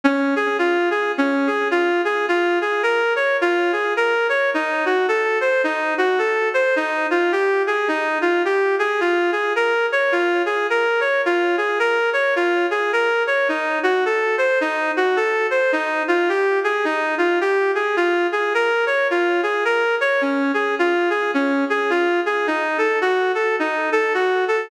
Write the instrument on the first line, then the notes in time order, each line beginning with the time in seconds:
clarinet
0.04 C#4
0.36 G#4
0.59 F4
0.91 G#4
1.18 C#4
1.47 G#4
1.71 F4
2.05 G#4
2.28 F4
2.61 G#4
2.83 A#4
3.16 C#5
3.41 F4
3.72 G#4
3.97 A#4
4.29 C#5
4.54 D#4
4.86 F#4
5.08 A4
5.41 C5
5.64 D#4
5.98 F#4
6.19 A4
6.54 C5
6.76 D#4
7.11 F4
7.32 G4
7.67 G#4
7.88 D#4
8.21 F4
8.45 G4
8.79 G#4
9.00 F4
9.32 G#4
9.56 A#4
9.92 C#5
10.12 F4
10.46 G#4
10.70 A#4
11.00 C#5
11.26 F4
11.57 G#4
11.79 A#4
12.13 C#5
12.36 F4
12.71 G#4
12.93 A#4
13.27 C#5
13.48 D#4
13.83 F#4
14.05 A4
14.38 C5
14.61 D#4
14.97 F#4
15.16 A4
15.50 C5
15.72 D#4
16.08 F4
16.29 G4
16.64 G#4
16.85 D#4
17.18 F4
17.41 G4
17.75 G#4
17.96 F4
18.32 G#4
18.54 A#4
18.86 C#5
19.11 F4
19.43 G#4
19.65 A#4
20.01 C#5
20.21 C#4
20.54 G#4
20.79 F4
21.10 G#4
21.34 C#4
21.70 G#4
21.90 F4
22.26 G#4
22.47 D#4
22.78 A4
23.01 F#4
23.35 A4
23.59 D#4
23.92 A4
24.14 F#4
24.48 A4